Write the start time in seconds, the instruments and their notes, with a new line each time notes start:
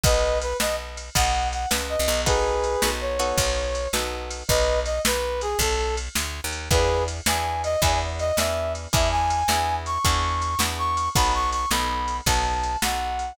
0.03 electric bass (finger) B1, brass section B4 D#5, acoustic guitar (steel) B4 D#5 F#5 A5, kick, ride
0.42 brass section B4, ride
0.60 electric bass (finger) B1, acoustic guitar (steel) B4 D#5 F#5 A5, brass section D#5, snare
0.97 ride
1.15 electric bass (finger) B1, acoustic guitar (steel) B4 D#5 F#5 A5, brass section F#5, kick, ride
1.52 brass section F#5, ride
1.71 electric bass (finger) C#2, acoustic guitar (steel) B4 D#5 F#5 A5, snare
1.90 brass section D#5
1.99 electric bass (finger) C2
2.08 electric bass (finger) B1, ride
2.26 acoustic guitar (steel) B3 D#4 F#4 A4, brass section G#4 B4, kick, ride
2.64 ride
2.82 electric bass (finger) B1, acoustic guitar (steel) B3 D#4 F#4 A4, snare
3.01 brass section C#5
3.19 acoustic guitar (steel) B3 D#4 F#4 A4, ride
3.38 electric bass (finger) B1, kick, ride
3.75 ride
3.93 electric bass (finger) B1, acoustic guitar (steel) B3 D#4 F#4 A4, snare
4.31 ride
4.48 electric bass (finger) B1, brass section B4 D#5, kick, ride
4.85 brass section D#5, ride
5.05 electric bass (finger) B1, brass section B4, snare
5.41 brass section G#4, ride
5.59 electric bass (finger) B1, brass section A4, kick, ride
5.97 ride
6.15 electric bass (finger) D2, snare
6.44 electric bass (finger) D#2
6.52 ride
6.71 electric bass (finger) E2, acoustic guitar (steel) B3 D4 E4 G#4, brass section G#4 B4, kick, ride
7.08 ride
7.26 electric bass (finger) E2, acoustic guitar (steel) B3 D4 E4 G#4, brass section G#5, snare
7.64 brass section D#5, ride
7.82 electric bass (finger) E2, acoustic guitar (steel) B3 D4 E4 G#4, brass section G#5, kick, ride
8.19 brass section D#5, ride
8.37 electric bass (finger) E2, acoustic guitar (steel) B3 D4 E4 G#4, brass section E5, snare
8.75 ride
8.93 electric bass (finger) E2, acoustic guitar (steel) B3 D4 E4 G#4, brass section E5, kick, ride
9.11 brass section G#5
9.30 ride
9.48 electric bass (finger) E2, acoustic guitar (steel) B3 D4 E4 G#4, snare
9.86 brass section C#6, ride
10.05 electric bass (finger) E2, acoustic guitar (steel) B3 D4 E4 G#4, kick, ride
10.42 ride
10.59 electric bass (finger) E2, acoustic guitar (steel) B3 D4 E4 G#4, snare
10.78 brass section C#6
10.97 ride
11.15 electric bass (finger) B1, acoustic guitar (steel) B3 D#4 F#4 A4, brass section B5, kick, ride
11.34 brass section C#6
11.52 brass section C#6, ride
11.71 electric bass (finger) B1, acoustic guitar (steel) B3 D#4 F#4 A4, brass section B5, snare
12.08 ride
12.26 electric bass (finger) B1, acoustic guitar (steel) B3 D#4 F#4 A4, brass section A5, kick, ride
12.63 ride
12.82 electric bass (finger) B1, acoustic guitar (steel) B3 D#4 F#4 A4, brass section F#5, snare
13.19 ride